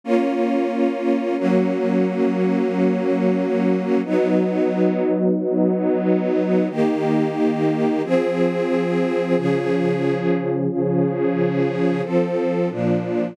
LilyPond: \new Staff { \time 6/8 \key ees \mixolydian \tempo 4. = 90 <bes des' f'>2. | \key fis \mixolydian <fis ais cis'>2.~ | <fis ais cis'>2. | <fis b dis'>2.~ |
<fis b dis'>2. | \key ees \mixolydian <ees bes g'>2. | <f c' aes'>2. | <des f aes'>2. |
<des f aes'>2. | \key f \mixolydian <f c' a'>4. <bes, f d'>4. | }